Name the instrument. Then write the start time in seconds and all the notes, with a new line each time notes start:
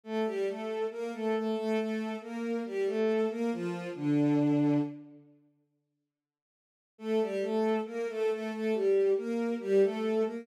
violin
0.04 A3 A4
0.25 G3 G4
0.47 A3 A4
0.90 A#3 A#4
1.13 A3 A4
1.34 A3 A4
1.55 A3 A4
1.77 A3 A4
2.21 A#3 A#4
2.65 G3 G4
2.86 A3 A4
3.29 A#3 A#4
3.52 F3 F4
3.95 D3 D4
6.98 A3 A4
7.21 G3 G4
7.42 A3 A4
7.85 A#3 A#4
8.08 A3 A4
8.30 A3 A4
8.52 A3 A4
8.73 G3 G4
9.16 A#3 A#4
9.60 G3 G4
9.82 A3 A4
10.25 A#3 A#4